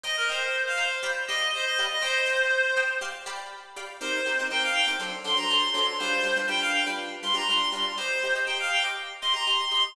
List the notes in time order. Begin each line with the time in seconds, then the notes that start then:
0.04 C5 D#5 G5 A#5
0.17 A#4
0.29 C5 D#5 G5 A#5
0.67 F5
0.77 C5 D#5 G5 A#5
1.03 G4 D5 F5 B5
1.27 G4 D5 D#5 F5 B5
1.53 C5
1.65 D#5
1.79 G4 D5 F5 B5
1.91 D#5
2.02 C5 D#5 G5 A#5
2.26 C5 D#5 G5 A#5
2.76 C5 D#5 G5 A#5
3.01 G4 D5 F5 C6
3.26 G4 D5 F5 B5
3.76 G4 D5 F5 B5
4.01 C4 D#4 G4 A#4 C5
4.26 C4 D#4 G4 A#4
4.39 C4 D#4 G4 A#4
4.51 C4 D#4 G4 A#4 G5
4.63 F5
4.74 G5
4.87 C4 D#4 G4 A#4
4.99 F#3 D4 A4 C5
5.24 F#3 D4 A4 C5 C6
5.37 F#3 D4 A4 C5 A#5
5.49 F#3 D4 A4 C5 C6
5.74 F#3 D4 A4 C5 C6
5.99 G3 D4 F4 B4 C5
6.23 G3 D4 F4 B4
6.36 G3 D4 F4 B4
6.48 G3 D4 F4 B4 G5
6.61 F5
6.73 G5
6.87 G3 D4 F4 B4
7.23 G3 D4 F4 B4 C6
7.34 G3 D4 F4 B4 A#5
7.48 G3 D4 F4 B4 C6
7.72 G3 D4 F4 B4 C6
7.98 G4 C5 D#5 A#5 C6
8.24 G4 D#5 A#5 C6
8.35 G4 D#5 A#5 C6
8.46 G4 D#5 G5 A#5 C6
8.60 F5
8.71 G5
8.84 G4 D#5 A#5 C6
9.21 G4 D#5 A#5 C6
9.33 G4 D#5 A#5 C6
9.46 G4 D#5 A#5 C6
9.71 G4 D#5 A#5 C6